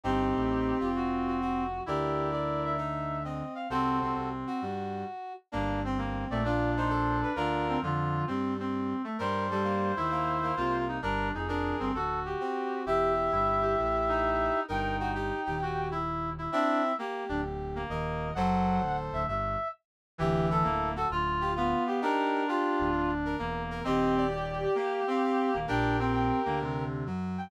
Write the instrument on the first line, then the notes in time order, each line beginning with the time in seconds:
brass section
0.04 G1 G2 C4 D#4 G4
0.35 A1 A2
0.80 F1 F2 F4
0.96 F#4
1.27 F#4
1.41 F#4
1.86 D2 D3 E4 G4 A#4 D5
2.32 D5
2.65 E5
2.78 D#4
3.24 C4 D#5
3.55 F5
3.70 C2 C3 C4 F#4 A4 C5
4.01 C2 C3 C4
4.15 C2 C3
4.47 F#4
4.62 G2 G3
5.52 G1 G2 A#3 D4
5.84 C4
5.98 A#3
6.30 A#1 A#2 A3 D5
6.44 D4 F4 D5
6.77 D#4 C5
6.90 A4
7.23 B4
7.36 D2 D3 D4 F4 A#4
7.69 C4
7.82 F2 D3 F3 F4
8.27 G2 G3 C4
8.60 C4
9.04 A3
9.19 G2 G3 A#4 C5
9.51 G3 A4
9.64 A#3
9.96 D#2 D#3 E4
10.11 A#3
10.43 A#3
10.56 C2 C3 A#3 F4
10.89 D#4
11.02 G1 G2 D4 A#4
11.34 F1 F2 D#4 G#4
11.48 D4 A#4
11.80 G1 G2 C4
11.94 D1 D2 F#4 A4
12.26 G4
12.40 C4
12.86 E1 E2 E4 G4 E5
13.32 G1 G2 E4
13.62 G4
13.78 A1 A2
14.09 D#4
14.68 G1 G2 D#4 A#4 G5
15.00 F#4 G5
15.15 G4
15.46 D#1 D#2 G4
15.62 F#4
15.92 E4
16.38 E4
16.52 C4 D4 E4 E5
16.98 A#3 G4
17.29 D1 D2 D4
17.76 A#3
17.89 D#1 D#2 A#4 D#5
18.35 F#1 F#2 F#3 A4 C5 F#5
18.81 D1 D2
19.12 D1 D2 E5
19.28 G1 G2 E5
20.18 D1 D2 E3 E4 G4
20.50 E4 A4
20.64 D1 D2 A#3
20.96 F#4 A4
21.10 D1 D2 F4
21.41 G4
21.56 B3 F4 F5
21.87 G4
22.02 D4 D#4 G4 A#4
22.48 F4 G4
22.79 D1 D2
23.25 A#4
23.39 E1 E2 A#3
23.71 A#4
23.84 D#1 D#2 C4 G4 D#5
24.17 D5
24.31 G4
24.63 G4
24.75 A#3 F5
25.07 C4 F5
25.24 F5
25.53 D#1 D#2 A#3
25.67 A#1 A#2 D4 G4 A#4 G5
25.99 C4 G5
26.15 G5
26.46 D2 D3 A#3
26.62 C3
27.06 F#2 F#3
27.38 G5